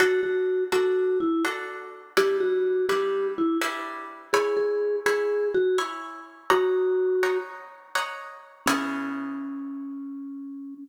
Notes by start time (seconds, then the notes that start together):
0.00 D4 F#4 A4
0.23 F#4
0.72 D4 F#4 A4
1.20 E4
1.45 D4 F#4 A4
2.17 G3 D4 E4 G4 B4
2.40 F#4
2.89 G3 D4 E4 G4 B4
3.38 E4
3.61 G3 D4 E4 B4
4.33 E4 G#4 C#5 G#5 B5
4.57 G#4
5.06 E4 G#4 C#5 G#5 B5
5.54 F#4
5.78 E4 C#5 G#5 B5
6.50 D#4 F#4 C#5 F#5 A#5
7.23 D#4 C#5 F#5 A#5
7.95 D#4 C#5 F#5 A#5
8.66 C#3 B3 C#4 E4 G#4